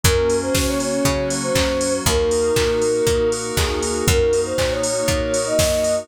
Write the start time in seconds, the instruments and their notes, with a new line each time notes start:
0.03 electric bass (finger) F#2, pad 5 (bowed) A#3 C#4 F#4, electric piano 2 A#3, flute A#4, kick, closed hi-hat
0.29 electric piano 2 C#4, open hi-hat
0.42 flute C5
0.54 electric bass (finger) C#3, electric piano 2 F#4, flute C5, kick, snare
0.68 flute C#5
0.80 electric piano 2 A#3, flute C#5, open hi-hat
1.05 electric bass (finger) C#3, pad 5 (bowed) F#3 A#3 F#4, electric piano 2 C#4, kick, closed hi-hat
1.30 electric piano 2 F#4, open hi-hat
1.43 flute C5
1.55 electric bass (finger) F#2, electric piano 2 A#3, kick, clap
1.81 electric piano 2 C#4, open hi-hat
2.06 electric bass (finger) D#2, pad 5 (bowed) A#3 D#4 F#4, electric piano 2 A#3, flute A#4, kick, closed hi-hat
2.31 electric piano 2 D#4, open hi-hat
2.56 electric bass (finger) A#2, electric piano 2 F#4, kick, clap
2.81 electric piano 2 A#3, open hi-hat
3.06 electric bass (finger) A#2, pad 5 (bowed) A#3 F#4 A#4, electric piano 2 D#4, kick, closed hi-hat
3.32 electric piano 2 F#4, open hi-hat
3.57 electric bass (finger) D#2, electric piano 2 A#3, flute G#4, kick, clap
3.82 electric piano 2 D#4, open hi-hat
4.07 electric bass (finger) F#2, pad 5 (bowed) A#3 D#4 F#4, electric piano 2 A#3, flute A#4, kick, closed hi-hat
4.33 electric piano 2 D#4, open hi-hat
4.45 flute C5
4.58 electric bass (finger) A#2, electric piano 2 F#4, flute C5, kick, clap
4.71 flute C#5
4.83 electric piano 2 A#3, flute C#5, open hi-hat
5.07 electric bass (finger) A#2, pad 5 (bowed) A#3 F#4 A#4, electric piano 2 D#4, kick, closed hi-hat
5.34 electric piano 2 F#4, open hi-hat
5.46 flute D#5
5.58 electric bass (finger) F#2, electric piano 2 A#3, kick, snare
5.84 electric piano 2 D#4, open hi-hat